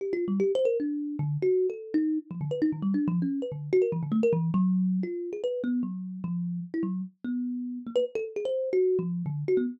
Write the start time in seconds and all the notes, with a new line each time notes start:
0.01 G4
0.13 F4
0.28 G3
0.40 G4
0.55 C5
0.65 A#4
0.80 D4
1.19 D3
1.42 F#4
1.70 A4
1.94 D#4
2.31 F3
2.41 D3
2.51 B4
2.62 D#4
2.72 D#3
2.82 G3
2.94 D4
3.08 F3
3.22 C#4
3.42 B4
3.52 D3
3.73 F#4
3.82 A#4
3.92 E3
4.03 D3
4.12 A3
4.23 A#4
4.33 E3
4.54 F#3
5.03 F4
5.33 G#4
5.44 B4
5.64 B3
5.83 F#3
6.24 F3
6.74 E4
6.83 F#3
7.24 B3
7.87 A#3
7.96 B4
8.15 A4
8.36 G#4
8.45 C5
8.73 F#4
8.99 F3
9.26 D3
9.48 F#4
9.57 B3